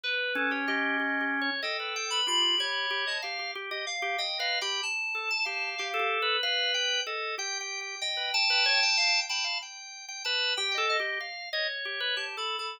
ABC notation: X:1
M:5/8
L:1/16
Q:1/4=94
K:none
V:1 name="Drawbar Organ"
z2 ^C8 | A4 F2 ^c4 | f2 z ^d z2 (3d2 f2 g2 | z3 a f3 A3 |
B4 A2 G4 | ^d2 a6 a2 | z4 a2 z g z2 | f2 ^c5 z3 |]
V:2 name="Drawbar Organ"
B2 A G G2 (3G2 G2 ^c2 | ^d B g B G G G2 G d | G G G G z G (3^d2 B2 G2 | z2 A z G2 (3G2 G2 B2 |
f2 g2 ^d2 (3g2 g2 g2 | z B z B ^c g g2 g f | g3 g B2 (3G2 A2 G2 | z2 ^d z G B (3G2 A2 A2 |]
V:3 name="Electric Piano 2"
B3 ^c ^d4 z2 | g3 b b2 b3 a | z4 f2 (3g2 ^d2 b2 | a6 f2 z2 |
z10 | g6 f z b2 | z6 g ^d d2 | z6 (3a2 b2 b2 |]